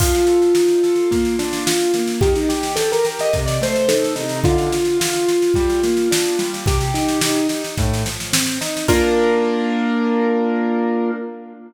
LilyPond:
<<
  \new Staff \with { instrumentName = "Acoustic Grand Piano" } { \time 4/4 \key bes \major \tempo 4 = 108 f'1 | g'16 ees'16 g'8 a'16 bes'16 r16 ees''16 r16 d''16 c''8 a'8 ees'8 | f'1 | g'4. r2 r8 |
bes'1 | }
  \new Staff \with { instrumentName = "Acoustic Grand Piano" } { \time 4/4 \key bes \major f8 a'8 ees'8 a'8 bes8 d'8 f'8 bes8 | ees8 g'8 g'8 g'8 c8 a8 ees'8 c8 | d8 f'8 f'8 f'8 g8 bes8 d'8 g8 | c8 ees'8 ees'8 ees'8 a,8 f8 c'8 ees'8 |
<bes d' f'>1 | }
  \new DrumStaff \with { instrumentName = "Drums" } \drummode { \time 4/4 <cymc bd sn>16 sn16 sn16 sn16 sn16 sn16 sn16 sn16 <bd sn>16 sn16 sn16 sn16 sn16 sn16 sn16 sn16 | <bd sn>16 sn16 sn16 sn16 sn16 sn16 sn16 sn16 <bd sn>16 sn16 sn16 sn16 sn16 sn16 sn16 sn16 | <bd sn>16 sn16 sn16 sn16 sn16 sn16 sn16 sn16 <bd sn>16 sn16 sn16 sn16 sn16 sn16 sn16 sn16 | <bd sn>16 sn16 sn16 sn16 sn16 sn16 sn16 sn16 <bd sn>16 sn16 sn16 sn16 sn16 sn16 sn16 sn16 |
<cymc bd>4 r4 r4 r4 | }
>>